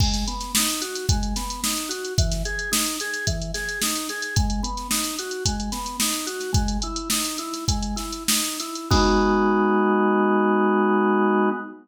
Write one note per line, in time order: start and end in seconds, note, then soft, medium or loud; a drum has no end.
0.00 0.24 G#3 medium
0.00 kick loud
0.00 crash loud
0.14 snare soft
0.14 closed hi-hat medium
0.28 0.52 B3 medium
0.28 closed hi-hat medium
0.40 snare soft
0.40 closed hi-hat medium
0.55 0.81 D#4 medium
0.55 snare loud
0.68 closed hi-hat medium
0.81 1.06 F#4 medium
0.81 closed hi-hat medium
0.95 snare soft
0.95 closed hi-hat medium
1.09 1.34 G#3 medium
1.09 kick loud
1.09 closed hi-hat loud
1.23 closed hi-hat medium
1.36 1.61 B3 medium
1.36 snare medium
1.36 closed hi-hat medium
1.50 closed hi-hat medium
1.64 1.88 D#4 medium
1.64 snare loud
1.77 closed hi-hat medium
1.89 2.14 F#4 medium
1.89 closed hi-hat medium
2.05 closed hi-hat medium
2.18 2.43 E3 medium
2.18 kick loud
2.18 closed hi-hat loud
2.32 snare soft
2.32 closed hi-hat medium
2.45 2.70 G#4 medium
2.45 closed hi-hat medium
2.59 closed hi-hat medium
2.72 2.96 D#4 medium
2.72 snare loud
2.86 closed hi-hat medium
3.00 3.25 G#4 medium
3.00 closed hi-hat medium
3.14 closed hi-hat medium
3.27 3.52 E3 medium
3.27 kick medium
3.27 closed hi-hat loud
3.42 closed hi-hat medium
3.54 3.79 G#4 medium
3.54 snare medium
3.54 closed hi-hat medium
3.69 closed hi-hat medium
3.82 4.07 D#4 medium
3.82 snare loud
3.96 closed hi-hat medium
4.09 4.34 G#4 medium
4.09 snare soft
4.09 closed hi-hat medium
4.22 closed hi-hat medium
4.36 4.61 G#3 medium
4.36 kick loud
4.36 closed hi-hat loud
4.50 closed hi-hat medium
4.63 4.88 B3 medium
4.63 closed hi-hat medium
4.77 snare soft
4.77 closed hi-hat medium
4.91 5.15 D#4 medium
4.91 snare loud
5.04 snare soft
5.04 closed hi-hat medium
5.19 5.44 F#4 medium
5.19 closed hi-hat medium
5.31 closed hi-hat medium
5.45 5.70 G#3 medium
5.45 kick medium
5.45 closed hi-hat loud
5.60 closed hi-hat medium
5.72 5.97 B3 medium
5.72 snare medium
5.72 closed hi-hat medium
5.86 closed hi-hat medium
6.00 6.26 D#4 medium
6.00 snare loud
6.13 closed hi-hat medium
6.27 6.51 F#4 medium
6.27 closed hi-hat medium
6.40 snare soft
6.40 closed hi-hat medium
6.53 6.77 G#3 medium
6.53 kick loud
6.53 closed hi-hat loud
6.68 closed hi-hat medium
6.82 7.09 E4 medium
6.82 closed hi-hat medium
6.96 closed hi-hat medium
7.10 7.37 D#4 medium
7.10 snare loud
7.25 closed hi-hat medium
7.38 7.65 E4 medium
7.38 closed hi-hat medium
7.53 snare soft
7.53 closed hi-hat medium
7.68 7.95 G#3 medium
7.68 kick loud
7.68 closed hi-hat loud
7.83 closed hi-hat medium
7.96 8.24 E4 medium
7.96 snare medium
7.96 closed hi-hat medium
8.12 closed hi-hat medium
8.28 8.57 D#4 medium
8.28 snare loud
8.44 closed hi-hat medium
8.60 8.89 E4 medium
8.60 snare soft
8.60 closed hi-hat medium
8.75 closed hi-hat medium
8.90 11.49 G#3 loud
8.90 11.49 B3 medium
8.90 11.49 D#4 loud
8.90 11.49 F#4 loud
8.90 kick loud
8.90 crash loud